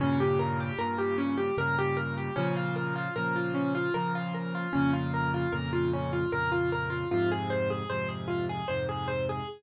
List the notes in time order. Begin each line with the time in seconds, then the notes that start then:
0.00 G2 A#2 C#3 C#4
0.20 G4
0.39 A#4
0.60 G4
0.78 G2 A#2 C#3 A#4
0.98 G4
1.18 C#4
1.38 G4
1.58 G2 A#2 C#3 A#4
1.78 G4
1.97 A#4
2.18 G4
2.36 A#2 C#3 F3 C#4
2.57 F4
2.76 A#4
2.96 F4
3.16 A#2 C#3 F3 A#4
3.36 F4
3.54 C#4
3.75 F4
3.94 A#2 C#3 F3 A#4
4.15 F4
4.34 A#4
4.55 F4
4.73 F2 A#2 C#3 C#4
4.93 F4
5.14 A#4
5.34 F4
5.52 F2 A#2 C#3 A#4
5.73 F4
5.93 C#4
6.13 F4
6.32 F2 A#2 C#3 A#4
6.52 F4
6.72 A#4
6.90 F4
7.11 F2 G#2 C3 F4
7.32 G#4
7.50 C5
7.70 G#4
7.90 F2 G#2 C3 C5
8.08 G#4
8.28 F4
8.49 G#4
8.68 F2 G#2 C3 C5
8.89 G#4
9.08 C5
9.29 G#4